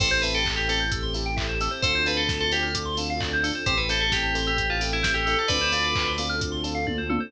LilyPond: <<
  \new Staff \with { instrumentName = "Tubular Bells" } { \time 4/4 \key a \minor \tempo 4 = 131 c''8 b'16 a'16 r16 g'16 a'16 r2 r16 | c''8 b'16 a'16 r16 a'16 g'16 r2 r16 | c''16 b'16 a'16 a'16 g'8 r16 g'8 f'16 r16 e'8 g'8 a'16 | <b' d''>4. r2 r8 | }
  \new Staff \with { instrumentName = "Electric Piano 1" } { \time 4/4 \key a \minor <c' e' g' a'>8 <c' e' g' a'>4 <c' e' g' a'>4 <c' e' g' a'>4 <c' e' g' a'>8 | <c' d' f' a'>8 <c' d' f' a'>4 <c' d' f' a'>4 <c' d' f' a'>4 <c' d' f' a'>8 | <c' e' g' a'>8 <c' e' g' a'>4 <c' e' g' a'>4 <c' e' g' a'>4 <c' e' g' a'>8 | <c' d' f' a'>8 <c' d' f' a'>4 <c' d' f' a'>4 <c' d' f' a'>4 <c' d' f' a'>8 | }
  \new Staff \with { instrumentName = "Electric Piano 2" } { \time 4/4 \key a \minor a'16 c''16 e''16 g''16 a''16 c'''16 e'''16 g'''16 e'''16 c'''16 a''16 g''16 e''16 c''16 a'16 c''16 | a'16 c''16 d''16 f''16 a''16 c'''16 d'''16 f'''16 d'''16 c'''16 a''16 f''16 d''16 c''16 a'16 c''16 | g'16 a'16 c''16 e''16 g''16 a''16 c'''16 e'''16 c'''16 a''16 g''16 e''16 c''16 a'16 a'8~ | a'16 c''16 d''16 f''16 a''16 c'''16 d'''16 f'''16 d'''16 c'''16 a''16 f''16 d''16 c''16 a'16 c''16 | }
  \new Staff \with { instrumentName = "Synth Bass 1" } { \clef bass \time 4/4 \key a \minor a,,1 | d,1 | a,,1 | d,1 | }
  \new Staff \with { instrumentName = "String Ensemble 1" } { \time 4/4 \key a \minor <c' e' g' a'>1 | <c' d' f' a'>1 | <c' e' g' a'>1 | <c' d' f' a'>1 | }
  \new DrumStaff \with { instrumentName = "Drums" } \drummode { \time 4/4 <cymc bd>8 hho8 <hc bd>8 hho8 <hh bd>8 hho8 <hc bd>8 hho8 | <hh bd>8 hho8 <bd sn>8 hho8 <hh bd>8 hho8 <hc bd>8 hho8 | <hh bd>8 hho8 <bd sn>8 hho8 <hh bd>8 hho8 <bd sn>8 hho8 | <hh bd>8 hho8 <hc bd>8 hho8 <hh bd>8 hho8 <bd tommh>8 tommh8 | }
>>